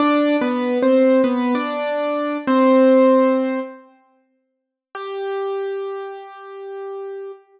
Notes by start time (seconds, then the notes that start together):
0.00 D4 D5
0.41 B3 B4
0.82 C4 C5
1.24 B3 B4
1.55 D4 D5
2.47 C4 C5
4.95 G4